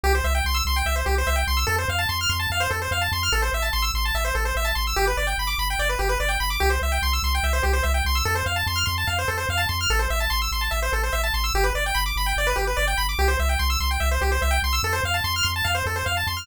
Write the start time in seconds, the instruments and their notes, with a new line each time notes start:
0.04 synth bass 1 C2, lead 1 (square) G4
0.15 lead 1 (square) C5
0.24 synth bass 1 C2, lead 1 (square) E5
0.35 lead 1 (square) G5
0.45 synth bass 1 C2, lead 1 (square) C6
0.54 lead 1 (square) E6
0.65 synth bass 1 C2, lead 1 (square) C6
0.76 lead 1 (square) G5
0.86 synth bass 1 C2, lead 1 (square) E5
0.96 lead 1 (square) C5
1.06 synth bass 1 C2, lead 1 (square) G4
1.18 lead 1 (square) C5
1.27 synth bass 1 C2, lead 1 (square) E5
1.36 lead 1 (square) G5
1.47 synth bass 1 C2, lead 1 (square) C6
1.57 lead 1 (square) E6
1.67 synth bass 1 F2, lead 1 (square) A4
1.78 lead 1 (square) C5
1.88 synth bass 1 F2, lead 1 (square) F5
1.99 lead 1 (square) A5
2.09 synth bass 1 F2, lead 1 (square) C6
2.21 lead 1 (square) F6
2.29 synth bass 1 F2, lead 1 (square) C6
2.40 lead 1 (square) A5
2.50 synth bass 1 F2, lead 1 (square) F5
2.60 lead 1 (square) C5
2.71 synth bass 1 F2, lead 1 (square) A4
2.82 lead 1 (square) C5
2.91 synth bass 1 F2, lead 1 (square) F5
3.01 lead 1 (square) A5
3.12 synth bass 1 F2, lead 1 (square) C6
3.23 lead 1 (square) F6
3.32 synth bass 1 A1, lead 1 (square) A4
3.42 lead 1 (square) C5
3.53 synth bass 1 A1, lead 1 (square) E5
3.62 lead 1 (square) A5
3.73 synth bass 1 A1, lead 1 (square) C6
3.82 lead 1 (square) E6
3.94 synth bass 1 A1, lead 1 (square) C6
4.05 lead 1 (square) A5
4.14 synth bass 1 A1, lead 1 (square) E5
4.25 lead 1 (square) C5
4.35 synth bass 1 A1, lead 1 (square) A4
4.45 lead 1 (square) C5
4.56 synth bass 1 A1, lead 1 (square) E5
4.65 lead 1 (square) A5
4.75 synth bass 1 A1, lead 1 (square) C6
4.87 lead 1 (square) E6
4.96 synth bass 1 G1, lead 1 (square) G4
5.07 lead 1 (square) B4
5.17 synth bass 1 G1, lead 1 (square) D5
5.27 lead 1 (square) G5
5.38 synth bass 1 G1, lead 1 (square) B5
5.47 lead 1 (square) D6
5.58 synth bass 1 G1, lead 1 (square) B5
5.70 lead 1 (square) G5
5.79 synth bass 1 G1, lead 1 (square) D5
5.89 lead 1 (square) B4
5.99 synth bass 1 G1, lead 1 (square) G4
6.09 lead 1 (square) B4
6.20 synth bass 1 G1, lead 1 (square) D5
6.29 lead 1 (square) G5
6.40 synth bass 1 G1, lead 1 (square) B5
6.50 lead 1 (square) D6
6.60 synth bass 1 C2, lead 1 (square) G4
6.70 lead 1 (square) C5
6.82 synth bass 1 C2, lead 1 (square) E5
6.92 lead 1 (square) G5
7.02 synth bass 1 C2, lead 1 (square) C6
7.13 lead 1 (square) E6
7.23 synth bass 1 C2, lead 1 (square) C6
7.35 lead 1 (square) G5
7.43 synth bass 1 C2, lead 1 (square) E5
7.53 lead 1 (square) C5
7.63 synth bass 1 C2, lead 1 (square) G4
7.73 lead 1 (square) C5
7.83 synth bass 1 C2, lead 1 (square) E5
7.94 lead 1 (square) G5
8.05 synth bass 1 C2, lead 1 (square) C6
8.15 lead 1 (square) E6
8.25 synth bass 1 F2, lead 1 (square) A4
8.35 lead 1 (square) C5
8.46 synth bass 1 F2, lead 1 (square) F5
8.56 lead 1 (square) A5
8.67 synth bass 1 F2, lead 1 (square) C6
8.76 lead 1 (square) F6
8.86 synth bass 1 F2, lead 1 (square) C6
8.98 lead 1 (square) A5
9.07 synth bass 1 F2, lead 1 (square) F5
9.19 lead 1 (square) C5
9.28 synth bass 1 F2, lead 1 (square) A4
9.38 lead 1 (square) C5
9.49 synth bass 1 F2, lead 1 (square) F5
9.57 lead 1 (square) A5
9.69 synth bass 1 F2, lead 1 (square) C6
9.81 lead 1 (square) F6
9.90 synth bass 1 A1, lead 1 (square) A4
9.99 lead 1 (square) C5
10.10 synth bass 1 A1, lead 1 (square) E5
10.20 lead 1 (square) A5
10.30 synth bass 1 A1, lead 1 (square) C6
10.42 lead 1 (square) E6
10.51 synth bass 1 A1, lead 1 (square) C6
10.61 lead 1 (square) A5
10.71 synth bass 1 A1, lead 1 (square) E5
10.82 lead 1 (square) C5
10.92 synth bass 1 A1, lead 1 (square) A4
11.03 lead 1 (square) C5
11.13 synth bass 1 A1, lead 1 (square) E5
11.23 lead 1 (square) A5
11.34 synth bass 1 A1, lead 1 (square) C6
11.44 lead 1 (square) E6
11.54 synth bass 1 G1, lead 1 (square) G4
11.64 lead 1 (square) B4
11.75 synth bass 1 G1, lead 1 (square) D5
11.86 lead 1 (square) G5
11.95 synth bass 1 G1, lead 1 (square) B5
12.06 lead 1 (square) D6
12.16 synth bass 1 G1, lead 1 (square) B5
12.26 lead 1 (square) G5
12.36 synth bass 1 G1, lead 1 (square) D5
12.47 lead 1 (square) B4
12.56 synth bass 1 G1, lead 1 (square) G4
12.67 lead 1 (square) B4
12.77 synth bass 1 G1, lead 1 (square) D5
12.88 lead 1 (square) G5
12.98 synth bass 1 G1, lead 1 (square) B5
13.09 lead 1 (square) D6
13.19 synth bass 1 C2, lead 1 (square) G4
13.28 lead 1 (square) C5
13.39 synth bass 1 C2, lead 1 (square) E5
13.49 lead 1 (square) G5
13.59 synth bass 1 C2, lead 1 (square) C6
13.70 lead 1 (square) E6
13.80 synth bass 1 C2, lead 1 (square) C6
13.91 lead 1 (square) G5
14.00 synth bass 1 C2, lead 1 (square) E5
14.11 lead 1 (square) C5
14.21 synth bass 1 C2, lead 1 (square) G4
14.32 lead 1 (square) C5
14.42 synth bass 1 C2, lead 1 (square) E5
14.51 lead 1 (square) G5
14.62 synth bass 1 C2, lead 1 (square) C6
14.73 lead 1 (square) E6
14.83 synth bass 1 F2, lead 1 (square) A4
14.93 lead 1 (square) C5
15.04 synth bass 1 F2, lead 1 (square) F5
15.14 lead 1 (square) A5
15.24 synth bass 1 F2, lead 1 (square) C6
15.36 lead 1 (square) F6
15.43 synth bass 1 F2, lead 1 (square) C6
15.56 lead 1 (square) A5
15.64 synth bass 1 F2, lead 1 (square) F5
15.75 lead 1 (square) C5
15.86 synth bass 1 F2, lead 1 (square) A4
15.96 lead 1 (square) C5
16.06 synth bass 1 F2, lead 1 (square) F5
16.17 lead 1 (square) A5
16.27 synth bass 1 F2, lead 1 (square) C6
16.37 lead 1 (square) F6